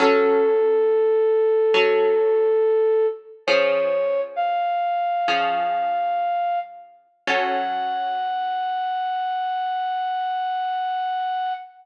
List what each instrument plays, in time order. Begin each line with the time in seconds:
0.00 orchestral harp F#3 C#4 A4, flute A4
1.74 orchestral harp F#3 C#4 A4
3.47 orchestral harp F3 C#4 G#4, flute C#5
4.36 flute F5
5.28 orchestral harp F3 C#4 G#4
7.27 orchestral harp F#3 C#4 A4, flute F#5